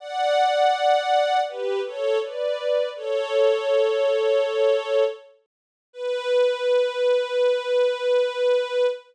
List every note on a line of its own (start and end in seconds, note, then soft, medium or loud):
0.00 1.39 D5 medium
0.00 1.39 F#5 medium
1.48 1.80 G4 medium
1.48 1.80 B4 medium
1.85 2.18 A4 medium
1.85 2.18 C#5 medium
2.22 2.89 B4 medium
2.22 2.89 D5 medium
2.96 5.04 A4 medium
2.96 5.04 C#5 medium
5.93 8.86 B4 loud